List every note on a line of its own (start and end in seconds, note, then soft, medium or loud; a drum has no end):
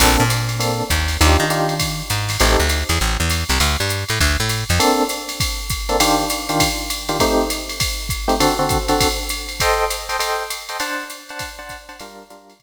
0.00 0.17 A#1 loud
0.00 0.23 A#3 medium
0.00 0.23 C4 loud
0.00 0.23 D4 loud
0.00 0.23 A4 medium
0.00 kick medium
0.00 crash medium
0.00 ride medium
0.20 0.83 A#2 medium
0.30 hi-hat pedal medium
0.30 ride medium
0.49 ride medium
0.59 0.83 A#3 medium
0.59 0.83 C4 medium
0.59 0.83 D4 medium
0.59 0.83 A4 medium
0.59 ride medium
0.90 1.17 D#2 medium
0.90 kick soft
0.90 hi-hat pedal medium
0.90 ride medium
1.08 snare soft
1.08 ride medium
1.21 1.37 D#2 loud
1.21 1.44 D4 medium
1.21 1.44 D#4 medium
1.21 1.44 F4 medium
1.21 1.44 G4 loud
1.21 ride medium
1.40 2.02 D#3 medium
1.50 1.74 D4 medium
1.50 1.74 D#4 medium
1.50 1.74 F4 medium
1.50 1.74 G4 medium
1.50 hi-hat pedal medium
1.50 ride medium
1.69 ride medium
1.80 kick soft
1.80 ride medium
2.10 2.37 G#2 medium
2.10 hi-hat pedal medium
2.10 ride medium
2.29 snare medium
2.29 ride medium
2.40 2.57 A1 medium
2.40 2.64 C4 loud
2.40 2.64 D#4 medium
2.40 2.64 G4 loud
2.40 2.64 A4 medium
2.40 ride medium
2.60 2.84 D2 medium
2.69 hi-hat pedal medium
2.69 ride medium
2.89 2.99 E2 medium
2.89 ride medium
3.00 3.17 A1 medium
3.00 ride soft
3.20 3.44 E2 medium
3.30 hi-hat pedal medium
3.30 ride medium
3.49 3.59 C2 medium
3.49 snare soft
3.49 ride medium
3.60 3.77 D2 medium
3.60 ride medium
3.80 4.04 G2 medium
3.89 hi-hat pedal medium
3.89 ride medium
4.09 4.19 A2 medium
4.09 ride medium
4.20 4.37 D2 medium
4.20 kick soft
4.20 ride medium
4.40 4.64 A2 medium
4.49 hi-hat pedal medium
4.49 ride medium
4.69 4.79 F2 medium
4.69 snare soft
4.69 ride medium
4.79 5.03 A#3 loud
4.79 5.03 C4 loud
4.79 5.03 D4 loud
4.79 5.03 A4 loud
4.79 ride loud
5.09 hi-hat pedal medium
5.09 ride medium
5.29 ride medium
5.40 kick medium
5.40 ride medium
5.70 kick medium
5.70 hi-hat pedal medium
5.70 ride medium
5.89 5.97 A#3 loud
5.89 5.97 C4 loud
5.89 5.97 D4 loud
5.89 5.97 A4 loud
5.89 ride medium
6.00 6.24 D#3 loud
6.00 6.24 D4 loud
6.00 6.24 F4 loud
6.00 6.24 G4 loud
6.00 ride loud
6.30 hi-hat pedal medium
6.30 ride medium
6.49 6.68 D#3 loud
6.49 6.68 D4 medium
6.49 6.68 F4 medium
6.49 6.68 G4 medium
6.49 ride medium
6.60 kick medium
6.60 ride loud
6.90 hi-hat pedal medium
6.90 ride medium
7.09 7.17 D#3 medium
7.09 7.17 D4 medium
7.09 7.17 F4 loud
7.09 7.17 G4 loud
7.09 ride medium
7.20 7.44 A3 loud
7.20 7.44 C4 loud
7.20 7.44 D#4 loud
7.20 7.44 G4 loud
7.20 kick medium
7.20 ride medium
7.50 hi-hat pedal medium
7.50 ride medium
7.69 ride medium
7.80 kick medium
7.80 ride medium
8.09 kick medium
8.09 hi-hat pedal medium
8.09 ride medium
8.28 8.36 A3 loud
8.28 8.36 C4 loud
8.28 8.36 D#4 medium
8.28 8.36 G4 loud
8.28 ride medium
8.40 8.54 D3 loud
8.40 8.54 C4 loud
8.40 8.54 F#4 loud
8.40 8.54 A4 loud
8.40 ride medium
8.59 8.78 D3 medium
8.59 8.78 C4 loud
8.59 8.78 F#4 medium
8.59 8.78 A4 medium
8.69 kick medium
8.69 hi-hat pedal medium
8.69 ride medium
8.88 9.07 D3 loud
8.88 9.07 C4 medium
8.88 9.07 F#4 medium
8.88 9.07 A4 medium
8.88 ride medium
9.01 kick medium
9.01 ride medium
9.29 hi-hat pedal medium
9.29 ride medium
9.49 ride medium
9.60 9.85 A4 loud
9.60 9.85 C5 loud
9.60 9.85 D#5 loud
9.60 9.85 G5 loud
9.60 kick medium
9.60 ride medium
9.90 hi-hat pedal medium
9.90 ride medium
10.09 10.17 A4 medium
10.09 10.17 C5 medium
10.09 10.17 D#5 medium
10.09 10.17 G5 medium
10.09 ride medium
10.19 10.43 A4 loud
10.19 10.43 C5 medium
10.19 10.43 D#5 medium
10.19 10.43 G5 medium
10.19 ride medium
10.50 hi-hat pedal medium
10.50 ride medium
10.69 10.77 A4 medium
10.69 10.77 C5 medium
10.69 10.77 D#5 medium
10.69 10.77 G5 medium
10.69 ride medium
10.80 11.04 D4 loud
10.80 11.04 C5 loud
10.80 11.04 F#5 loud
10.80 11.04 A5 loud
10.80 ride loud
11.10 hi-hat pedal medium
11.10 ride medium
11.29 11.49 D4 medium
11.29 11.49 C5 medium
11.29 11.49 F#5 loud
11.29 11.49 A5 medium
11.29 ride medium
11.39 kick medium
11.39 ride loud
11.59 11.77 D4 loud
11.59 11.77 C5 medium
11.59 11.77 F#5 loud
11.59 11.77 A5 medium
11.69 kick soft
11.69 hi-hat pedal medium
11.69 ride medium
11.89 11.96 D4 medium
11.89 11.96 C5 loud
11.89 11.96 F#5 medium
11.89 11.96 A5 medium
11.89 ride medium
12.00 12.24 G3 loud
12.00 12.24 D4 loud
12.00 12.24 F4 loud
12.00 12.24 A#4 loud
12.00 ride loud
12.30 12.54 G3 loud
12.30 12.54 D4 medium
12.30 12.54 F4 loud
12.30 12.54 A#4 medium
12.30 hi-hat pedal medium
12.30 ride medium
12.50 ride medium
12.60 kick medium
12.60 ride medium